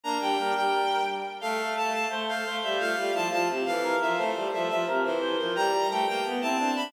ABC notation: X:1
M:2/2
L:1/8
Q:1/2=87
K:F
V:1 name="Violin"
b g2 g3 z2 | f2 a a z f2 e | f2 a a z f2 e | c2 e e z c2 B |
b2 g g z a2 =b |]
V:2 name="Choir Aahs"
D2 B4 z2 | A A A2 c z c2 | F F E F z A B2 | A A A2 B z c2 |
G G A G z E D2 |]
V:3 name="Violin"
B, G, G, G,3 z2 | A,4 A,2 A, G, | A, G, F, F, C, E,2 F, | A, G, F, F, C, E,2 F, |
G,2 A, B, =B, C C D |]